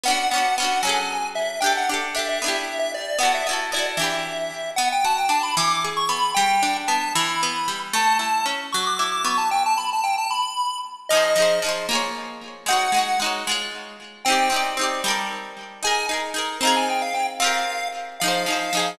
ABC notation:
X:1
M:6/8
L:1/16
Q:3/8=76
K:Em
V:1 name="Lead 1 (square)"
f2 f2 f2 ^g4 e2 | g f z2 e e4 e d2 | f e z2 d z e6 | [K:Bm] f g a g a b d'2 z c' b2 |
g4 a2 b6 | a2 a2 z2 c' d' d' d' c' a | g a b a g a b4 z2 | [K:Fm] e4 z8 |
_g4 z8 | g4 z8 | a2 z4 b a g f g z | f4 z2 f6 |]
V:2 name="Pizzicato Strings"
[B,^CDF]2 [B,CDF]2 [B,CDF]2 [F,C^GA]6 | [DGA]2 [DGA]2 [DGA]2 [B,DEG]6 | [B,EFA]2 [B,EFA]2 [B,EFA]2 [E,DGB]6 | [K:Bm] B,2 F2 D2 E,2 ^G2 B,2 |
G,2 D2 B,2 E,2 B,2 G,2 | A,2 E2 C2 F,2 E2 B,2 | z12 | [K:Fm] [F,EAc]2 [F,EAc]2 [F,EAc]2 [B,FAd]6 |
[A,E_Gd]2 [A,EGd]2 [A,EGd]2 [A,Fd]6 | [CEG=d]2 [CEGd]2 [CEGd]2 [G,=ABd]6 | [EAB]2 [EAB]2 [EAB]2 [CEFA]6 | [CFGB]6 [F,EAc]2 [F,EAc]2 [F,EAc]2 |]